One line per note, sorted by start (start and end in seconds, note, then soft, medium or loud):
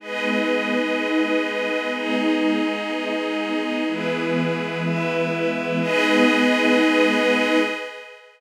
0.00 3.83 G#3 medium
0.00 3.83 B3 medium
0.00 3.83 D#4 medium
0.00 1.92 G#4 medium
0.00 1.92 B4 medium
0.00 1.92 D#5 medium
1.93 3.84 D#4 medium
1.93 3.84 G#4 medium
1.93 3.84 D#5 medium
3.87 5.79 E3 medium
3.87 5.79 G#3 medium
3.87 5.79 B3 medium
3.87 4.83 E4 medium
3.87 4.83 G#4 medium
3.87 4.83 B4 medium
4.83 5.79 E4 medium
4.83 5.79 B4 medium
4.83 5.79 E5 medium
5.81 7.58 G#3 medium
5.81 7.58 B3 loud
5.81 7.58 D#4 medium
5.81 7.58 G#4 loud
5.81 7.58 B4 loud
5.81 7.58 D#5 loud